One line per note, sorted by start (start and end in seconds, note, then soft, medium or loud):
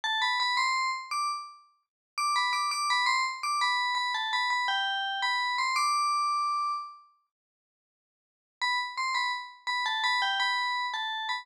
0.04 0.21 A5 medium
0.22 0.39 B5 medium
0.40 0.57 B5 medium
0.57 0.90 C6 medium
1.11 1.28 D6 medium
2.18 2.35 D6 medium
2.36 2.53 B5 medium
2.53 2.70 D6 medium
2.71 2.88 D6 medium
2.90 3.07 B5 medium
3.06 3.23 C6 medium
3.43 3.60 D6 medium
3.61 3.94 B5 medium
3.95 4.12 B5 medium
4.14 4.31 A5 medium
4.33 4.50 B5 medium
4.50 4.67 B5 medium
4.68 5.21 G5 medium
5.22 5.56 B5 medium
5.58 5.75 C6 medium
5.76 6.72 D6 medium
8.62 8.79 B5 medium
8.97 9.14 C6 medium
9.15 9.32 B5 medium
9.67 9.84 B5 medium
9.86 10.03 A5 medium
10.04 10.21 B5 medium
10.22 10.39 G5 medium
10.40 10.86 B5 medium
10.94 11.28 A5 medium
11.29 11.46 B5 medium